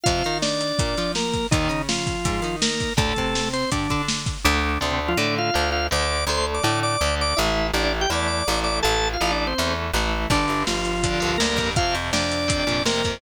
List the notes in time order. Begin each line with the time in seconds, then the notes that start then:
0.04 F2 C3 F3 F4 F5, kick, closed hi-hat
0.24 D#3 D#4, closed hi-hat
0.42 D4 D5, snare
0.61 closed hi-hat
0.79 A#2 A#3, kick, closed hi-hat
0.97 F3 F4, closed hi-hat
1.15 A#3 A#4, snare
1.33 kick, closed hi-hat
1.51 D#2 A#2 D#3 D#4, kick, closed hi-hat
1.69 C#3 C#4, closed hi-hat
1.89 F3 F4, snare
2.07 kick, closed hi-hat
2.25 G#2 G#3, kick, closed hi-hat
2.42 D#3 D#4, closed hi-hat
2.62 A#3 A#4, snare
2.80 kick, closed hi-hat
2.97 D2 A2 D3 A3 A4, kick, closed hi-hat
3.16 C3 C4, kick, closed hi-hat
3.35 snare
3.53 C4 C5, closed hi-hat
3.71 G2 D3 G3 D4, kick, closed hi-hat
3.90 D3 D4, kick, closed hi-hat
4.08 snare
4.26 kick, closed hi-hat
4.44 D2 D3 A3 D4
4.80 D2 C3 D3 A3 C4
4.90 C3 C4
5.08 F3 F4
5.17 A2 D3 A3 D4 D5
5.38 F4 F5
5.54 D2 D3 A3
5.72 F4 F5
5.91 D2 D3 A3 D5 D6
6.27 D2 D3 A3 C5 C6
6.37 C5 C6
6.54 D5 D6
6.63 A2 D3 A3 D5 D6
6.83 D5 D6
7.01 D2 D3 A3
7.21 D5 D6
7.37 A1 E3 A3 E4 E5
7.73 A1 E3 A3 D4 D5
7.84 D4 D5
8.01 G4 G5
8.10 E2 E3 A3 D5 D6
8.27 D5 D6
8.48 A1 E3 A3
8.64 D5 D6
8.82 A1 E3 A3 A4 A5
9.13 F4 F5
9.21 A1 E3 A3 F4 F5
9.31 D4 D5
9.47 C4 C5
9.58 E2 E3 A3
9.93 A1 E3 A3
10.30 G1 G2 D3 D4, kick, crash
10.48 G1, closed hi-hat
10.67 G1 F3 F4, snare
10.85 closed hi-hat
11.03 G2 D3, kick, closed hi-hat
11.20 C2 G2 D3, closed hi-hat
11.38 D2 G2 A#3 A#4, snare
11.42 D3
11.56 F2 G2 D3, kick, closed hi-hat
11.76 F2 C3 F4 F5, kick, closed hi-hat
11.95 F2, closed hi-hat
12.13 F2 D4 D5, snare
12.32 closed hi-hat
12.48 F2 C3, kick, closed hi-hat
12.67 F2 A#2 C3, closed hi-hat
12.85 F2 C3 A#3 A#4, snare
13.04 F2 C3, kick, closed hi-hat